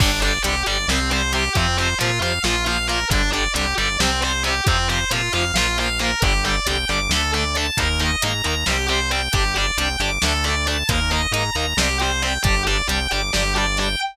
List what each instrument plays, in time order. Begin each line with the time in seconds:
0.00 synth bass 1 G1, overdriven guitar D3 G3, distortion guitar D4, kick, crash
0.22 overdriven guitar D3 G3, distortion guitar D5, closed hi-hat
0.42 synth bass 1 C2, overdriven guitar D3 G3, distortion guitar G4, closed hi-hat
0.66 synth bass 1 G1, overdriven guitar D3 G3, distortion guitar D5, closed hi-hat
0.88 synth bass 1 C2, overdriven guitar C3 G3, distortion guitar C4, snare
1.11 overdriven guitar C3 G3, distortion guitar C5, closed hi-hat
1.33 overdriven guitar C3 G3, distortion guitar G4, closed hi-hat
1.55 synth bass 1 F2, overdriven guitar C3 F3, distortion guitar C4, kick, closed hi-hat
1.78 overdriven guitar C3 F3, distortion guitar C5, closed hi-hat
1.99 synth bass 1 A#2, overdriven guitar C3 F3, distortion guitar F4, closed hi-hat
2.20 synth bass 1 F2, overdriven guitar C3 F3, distortion guitar F5, closed hi-hat
2.44 synth bass 1 A#1, overdriven guitar A#2 F3, distortion guitar F4, snare
2.66 overdriven guitar A#2 F3, distortion guitar F5, closed hi-hat
2.87 overdriven guitar A#2 F3, distortion guitar A#4, closed hi-hat
3.10 synth bass 1 G1, overdriven guitar D3 G3, distortion guitar D4, kick, closed hi-hat
3.32 overdriven guitar D3 G3, distortion guitar D5, closed hi-hat
3.54 synth bass 1 C2, overdriven guitar D3 G3, distortion guitar G4, closed hi-hat
3.77 synth bass 1 G1, overdriven guitar D3 G3, distortion guitar D5, closed hi-hat
4.00 synth bass 1 C2, overdriven guitar C3 G3, distortion guitar C4, snare
4.22 overdriven guitar C3 G3, distortion guitar C5, closed hi-hat
4.43 overdriven guitar C3 G3, distortion guitar G4, closed hi-hat
4.67 synth bass 1 F2, overdriven guitar C3 F3, distortion guitar C4, kick, closed hi-hat
4.89 overdriven guitar C3 F3, distortion guitar C5, closed hi-hat
5.11 synth bass 1 A#2, overdriven guitar C3 F3, distortion guitar F4, closed hi-hat
5.33 synth bass 1 F2, overdriven guitar C3 F3, distortion guitar F5, closed hi-hat
5.54 synth bass 1 A#1, overdriven guitar A#2 F3, distortion guitar F4, snare
5.78 overdriven guitar A#2 F3, distortion guitar F5, closed hi-hat
5.99 overdriven guitar A#2 F3, distortion guitar A#4, closed hi-hat
6.22 synth bass 1 G1, overdriven guitar D3 G3, distortion guitar G4, kick, closed hi-hat
6.45 overdriven guitar D3 G3, distortion guitar D5, closed hi-hat
6.66 synth bass 1 C2, overdriven guitar D3 G3, distortion guitar G5, closed hi-hat
6.89 synth bass 1 G1, overdriven guitar D3 G3, distortion guitar D6, closed hi-hat
7.09 synth bass 1 D2, overdriven guitar D3 A3, distortion guitar A4, snare
7.33 overdriven guitar D3 A3, distortion guitar D5, closed hi-hat
7.55 overdriven guitar D3 A3, distortion guitar A5, closed hi-hat
7.77 synth bass 1 D#2, overdriven guitar D#3 A#3, distortion guitar A#4, kick, closed hi-hat
8.00 overdriven guitar D#3 A#3, distortion guitar D#5, closed hi-hat
8.22 synth bass 1 G#2, overdriven guitar D#3 A#3, distortion guitar A#5, closed hi-hat
8.44 synth bass 1 D#2, overdriven guitar D#3 A#3, distortion guitar A#5, closed hi-hat
8.66 synth bass 1 C2, overdriven guitar G3 C4, distortion guitar G4, snare
8.88 overdriven guitar G3 C4, distortion guitar C5, closed hi-hat
9.11 overdriven guitar G3 C4, distortion guitar G5, closed hi-hat
9.33 synth bass 1 G1, overdriven guitar G3 D4, distortion guitar G4, kick, closed hi-hat
9.55 overdriven guitar G3 D4, distortion guitar D5, closed hi-hat
9.78 synth bass 1 C2, overdriven guitar G3 D4, distortion guitar G5, closed hi-hat
10.00 synth bass 1 G1, overdriven guitar G3 D4, distortion guitar D6, closed hi-hat
10.22 synth bass 1 D2, overdriven guitar A3 D4, distortion guitar A4, snare
10.44 overdriven guitar A3 D4, distortion guitar D5, closed hi-hat
10.67 overdriven guitar A3 D4, distortion guitar A5, closed hi-hat
10.89 synth bass 1 D#2, overdriven guitar A#3 D#4, distortion guitar A#4, kick, closed hi-hat
11.11 overdriven guitar A#3 D#4, distortion guitar D#5, closed hi-hat
11.31 synth bass 1 G#2, overdriven guitar A#3 D#4, distortion guitar A#5, closed hi-hat
11.55 synth bass 1 D#2, overdriven guitar A#3 D#4, distortion guitar A#5, closed hi-hat
11.77 synth bass 1 C2, overdriven guitar G3 C4, distortion guitar G4, snare
12.00 overdriven guitar G3 C4, distortion guitar C5, closed hi-hat
12.22 overdriven guitar G3 C4, distortion guitar G5, closed hi-hat
12.43 synth bass 1 G1, overdriven guitar G3 D4, distortion guitar G4, kick, closed hi-hat
12.67 overdriven guitar G3 D4, distortion guitar D5, closed hi-hat
12.88 synth bass 1 C2, overdriven guitar G3 D4, distortion guitar G5, closed hi-hat
13.11 synth bass 1 G1, overdriven guitar G3 D4, distortion guitar D6, closed hi-hat
13.33 synth bass 1 G1, overdriven guitar G3 D4, distortion guitar G4, snare
13.55 overdriven guitar G3 D4, distortion guitar D5, closed hi-hat
13.77 overdriven guitar G3 D4, distortion guitar G5, closed hi-hat